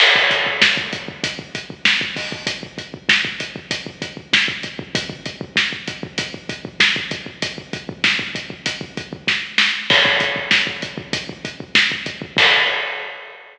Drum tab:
CC |x---------------|----------------|----------------|----------------|
HH |--x---x-x-x---o-|x-x---x-x-x---x-|x-x---x-x-x---x-|x-x---x-x-x-----|
SD |----o-------o---|----o-------o---|----o-------o---|----o-------o-o-|
BD |-ooooooooooooooo|oooooooooooooooo|oooooooooooooooo|ooooooooooooo---|

CC |x---------------|x---------------|
HH |--x---x-x-x---x-|----------------|
SD |----o-------o---|----------------|
BD |oooooooooooooooo|o---------------|